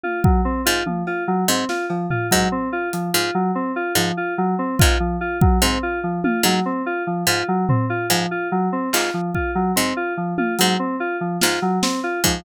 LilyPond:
<<
  \new Staff \with { instrumentName = "Harpsichord" } { \clef bass \time 6/4 \tempo 4 = 145 r4. gis,8 r4. gis,8 r4. gis,8 | r4. gis,8 r4. gis,8 r4. gis,8 | r4. gis,8 r4. gis,8 r4. gis,8 | r4. gis,8 r4. gis,8 r4. gis,8 |
r4. gis,8 r4. gis,8 r4. gis,8 | }
  \new Staff \with { instrumentName = "Electric Piano 2" } { \time 6/4 f'8 fis8 c'8 f'8 f8 f'8 fis8 c'8 f'8 f8 f'8 fis8 | c'8 f'8 f8 f'8 fis8 c'8 f'8 f8 f'8 fis8 c'8 f'8 | f8 f'8 fis8 c'8 f'8 f8 f'8 fis8 c'8 f'8 f8 f'8 | fis8 c'8 f'8 f8 f'8 fis8 c'8 f'8 f8 f'8 fis8 c'8 |
f'8 f8 f'8 fis8 c'8 f'8 f8 f'8 fis8 c'8 f'8 f8 | }
  \new DrumStaff \with { instrumentName = "Drums" } \drummode { \time 6/4 tommh8 bd8 r4 tommh8 cb8 r4 sn8 cb8 tomfh8 bd8 | r4 hh4 r4 r4 r4 r8 bd8 | r4 bd4 r4 tommh8 hc8 r4 r4 | r8 tomfh8 r4 r4 r8 hc8 r8 bd8 r8 cb8 |
r4 tommh8 hh8 r4 r8 sn8 r8 sn8 r8 bd8 | }
>>